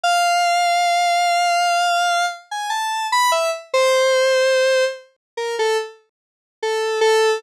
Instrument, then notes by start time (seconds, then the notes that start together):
lead 1 (square)
0.04 F5
2.51 G#5
2.70 A5
3.12 B5
3.32 E5
3.74 C5
5.37 A#4
5.59 A4
6.63 A4
7.01 A4